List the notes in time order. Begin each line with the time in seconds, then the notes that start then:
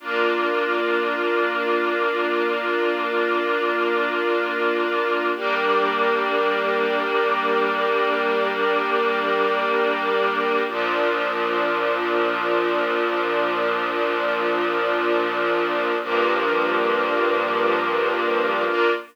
0.00 A#3 D4 F4
5.34 G3 A#3 D4
10.67 A#2 F3 D4
16.00 G2 F3 A#3 D4
18.66 A#3 D4 F4